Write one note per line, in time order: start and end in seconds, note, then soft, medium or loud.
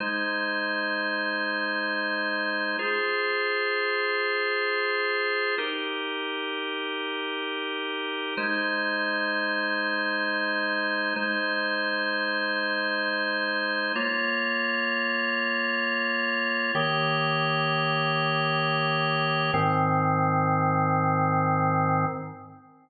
0.00 2.77 G#3 medium
0.00 2.77 D#4 medium
0.00 2.77 C5 medium
2.79 5.55 F4 medium
2.79 5.55 G#4 medium
2.79 5.55 C5 medium
5.58 8.34 D#4 medium
5.58 8.34 G4 medium
5.58 8.34 A#4 medium
8.37 11.14 G#3 medium
8.37 11.14 D#4 medium
8.37 11.14 C5 medium
11.16 13.92 G#3 medium
11.16 13.92 D#4 medium
11.16 13.92 C5 medium
13.95 16.72 A#3 medium
13.95 16.72 F4 medium
13.95 16.72 C#5 medium
16.75 19.51 D#3 medium
16.75 19.51 A#3 medium
16.75 19.51 G4 medium
16.75 19.51 C#5 medium
19.54 22.06 G#2 medium
19.54 22.06 D#3 loud
19.54 22.06 C4 loud